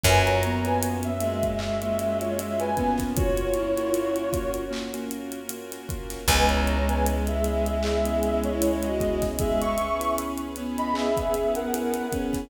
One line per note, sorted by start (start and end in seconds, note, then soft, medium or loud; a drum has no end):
0.04 5.79 F#2 loud
0.04 0.39 F#3 medium
0.04 3.13 A#3 medium
0.04 0.52 A#3 loud
0.04 3.13 C#4 medium
0.04 0.52 C#4 loud
0.04 3.13 F4 medium
0.04 0.52 F4 medium
0.04 3.13 F#4 medium
0.04 0.52 F#4 loud
0.04 0.25 B4 loud
0.04 0.25 G#5 loud
0.04 kick loud
0.04 closed hi-hat medium
0.26 0.42 C#5 medium
0.26 0.42 A#5 loud
0.26 closed hi-hat medium
0.43 1.10 B3 medium
0.43 0.64 C#5 medium
0.43 0.64 A#5 loud
0.43 closed hi-hat medium
0.65 1.11 A#3 medium
0.65 1.11 C#4 medium
0.65 1.11 F4 medium
0.65 1.11 F#4 medium
0.65 0.81 B4 loud
0.65 0.81 G#5 loud
0.65 closed hi-hat medium
0.83 closed hi-hat loud
1.03 1.50 E5 loud
1.03 closed hi-hat medium
1.20 2.70 G#3 medium
1.20 1.53 A#3 medium
1.20 1.53 C#4 medium
1.20 1.53 F4 medium
1.20 1.53 F#4 medium
1.20 closed hi-hat medium
1.43 kick medium
1.43 closed hi-hat medium
1.59 1.77 A#3 medium
1.59 1.77 C#4 medium
1.59 1.77 F4 medium
1.59 1.77 F#4 medium
1.59 2.18 E5 loud
1.59 clap loud
1.82 2.28 A#3 medium
1.82 2.28 C#4 medium
1.82 2.28 F4 medium
1.82 2.28 F#4 medium
1.82 closed hi-hat medium
1.99 closed hi-hat medium
2.21 2.37 F4 medium
2.21 2.37 C#5 loud
2.21 closed hi-hat medium
2.38 2.70 A#3 medium
2.38 2.70 C#4 medium
2.38 2.70 F4 medium
2.38 2.70 F#4 medium
2.38 2.59 E5 loud
2.38 closed hi-hat medium
2.60 2.93 B4 medium
2.60 2.93 G#5 loud
2.60 closed hi-hat medium
2.77 3.41 A#3 medium
2.77 3.11 B3 medium
2.77 3.41 C#4 loud
2.77 3.41 F4 medium
2.77 3.41 F#4 medium
2.77 kick medium
2.77 closed hi-hat medium
2.98 kick medium
2.98 snare medium
2.98 closed hi-hat medium
3.16 6.25 A#3 medium
3.16 6.25 C#4 medium
3.16 4.51 F4 loud
3.16 3.49 F#4 medium
3.16 6.25 F#4 medium
3.16 6.25 A#4 medium
3.16 4.51 C#5 loud
3.16 kick loud
3.16 closed hi-hat loud
3.38 closed hi-hat medium
3.54 4.24 E4 medium
3.54 closed hi-hat medium
3.76 4.22 A#3 medium
3.76 4.22 C#4 medium
3.76 4.22 F4 medium
3.76 4.22 F#4 loud
3.76 closed hi-hat medium
3.94 closed hi-hat medium
4.16 closed hi-hat medium
4.33 4.65 A#3 medium
4.33 4.65 C#4 medium
4.33 4.65 F4 medium
4.33 4.65 F#4 medium
4.33 kick medium
4.33 closed hi-hat medium
4.54 closed hi-hat medium
4.71 4.88 A#3 medium
4.71 4.88 C#4 medium
4.71 4.88 F4 medium
4.71 4.88 F#4 medium
4.71 clap loud
4.94 5.40 A#3 medium
4.94 5.40 C#4 loud
4.94 5.40 F4 medium
4.94 5.40 F#4 medium
4.94 snare soft
4.94 closed hi-hat medium
5.11 closed hi-hat medium
5.32 closed hi-hat medium
5.49 5.82 A#3 medium
5.49 5.82 C#4 medium
5.49 5.82 F4 medium
5.49 5.82 F#4 medium
5.49 closed hi-hat loud
5.72 snare soft
5.72 closed hi-hat medium
5.89 6.21 A#3 medium
5.89 6.21 C#4 medium
5.89 6.21 F4 medium
5.89 6.21 F#4 medium
5.89 kick medium
5.89 closed hi-hat medium
6.10 snare medium
6.10 closed hi-hat medium
6.28 12.02 C#2 loud
6.28 9.20 G#3 medium
6.28 9.37 B3 medium
6.28 6.77 B3 medium
6.28 9.37 C#4 medium
6.28 6.77 C#4 loud
6.28 9.37 E4 medium
6.28 6.77 E4 loud
6.28 9.37 G#4 medium
6.28 6.77 G#4 medium
6.28 6.48 B4 loud
6.28 6.48 G#5 loud
6.28 kick loud
6.28 closed hi-hat medium
6.49 6.66 C#5 medium
6.49 6.66 A#5 medium
6.49 closed hi-hat medium
6.67 6.87 C#5 medium
6.67 6.87 A#5 loud
6.67 closed hi-hat medium
6.88 7.34 B3 medium
6.88 7.34 C#4 medium
6.88 7.34 E4 medium
6.88 7.34 G#4 medium
6.88 7.05 B4 medium
6.88 7.05 G#5 loud
6.88 closed hi-hat medium
7.06 closed hi-hat medium
7.27 7.77 G#4 medium
7.27 7.77 E5 loud
7.27 closed hi-hat medium
7.44 7.77 B3 medium
7.44 7.77 C#4 medium
7.44 7.77 E4 medium
7.44 7.77 G#4 medium
7.44 closed hi-hat medium
7.66 closed hi-hat medium
7.83 8.01 B3 medium
7.83 8.01 C#4 medium
7.83 8.01 E4 loud
7.83 8.42 G#4 loud
7.83 8.01 G#4 medium
7.83 8.42 E5 loud
7.83 clap loud
8.04 8.50 B3 medium
8.04 8.50 C#4 medium
8.04 8.50 E4 medium
8.04 8.50 G#4 medium
8.04 closed hi-hat medium
8.23 closed hi-hat medium
8.44 8.61 E4 medium
8.44 8.61 C#5 loud
8.44 closed hi-hat medium
8.61 8.93 B3 medium
8.61 8.93 C#4 medium
8.61 8.93 E4 medium
8.61 8.82 E4 loud
8.61 8.93 G#4 medium
8.61 8.82 C#5 loud
8.61 closed hi-hat loud
8.83 9.15 F#4 loud
8.83 9.15 D#5 loud
8.83 closed hi-hat medium
9.00 9.64 B3 medium
9.00 9.64 C#4 medium
9.00 9.64 E4 medium
9.00 9.64 G#4 medium
9.00 kick medium
9.00 closed hi-hat medium
9.22 kick medium
9.22 snare medium
9.22 closed hi-hat medium
9.39 9.74 G#3 medium
9.39 12.48 B3 medium
9.39 12.48 C#4 medium
9.39 12.48 G#4 medium
9.39 9.60 G#4 loud
9.39 12.48 B4 medium
9.39 9.60 E5 loud
9.39 kick loud
9.39 closed hi-hat loud
9.61 10.11 E5 loud
9.61 10.11 C#6 loud
9.61 closed hi-hat medium
9.78 10.46 C#4 medium
9.78 closed hi-hat medium
10.00 10.46 B3 medium
10.00 10.46 C#4 medium
10.00 10.46 E4 medium
10.00 10.46 G#4 medium
10.00 closed hi-hat medium
10.18 closed hi-hat medium
10.38 closed hi-hat medium
10.56 12.06 B3 medium
10.56 10.89 B3 medium
10.56 10.89 C#4 medium
10.56 10.89 E4 medium
10.56 10.89 G#4 medium
10.56 closed hi-hat medium
10.78 10.94 D#5 loud
10.78 10.94 B5 loud
10.78 closed hi-hat medium
10.94 11.12 B3 medium
10.94 11.12 C#4 loud
10.94 11.12 E4 medium
10.94 11.12 G#4 medium
10.94 11.49 G#4 loud
10.94 11.49 E5 loud
10.94 clap loud
11.17 11.63 B3 medium
11.17 11.63 C#4 medium
11.17 11.63 E4 medium
11.17 11.63 G#4 medium
11.17 kick medium
11.17 closed hi-hat medium
11.34 closed hi-hat medium
11.55 12.06 A#4 medium
11.55 12.06 F#5 loud
11.55 closed hi-hat medium
11.73 12.05 B3 medium
11.73 12.05 C#4 medium
11.73 12.05 E4 loud
11.73 12.05 G#4 medium
11.73 closed hi-hat medium
11.94 closed hi-hat medium
12.12 12.44 B3 medium
12.12 12.44 C#4 medium
12.12 12.44 E4 medium
12.12 12.44 G#4 medium
12.12 kick medium
12.12 closed hi-hat medium
12.33 kick medium
12.33 snare medium
12.33 closed hi-hat medium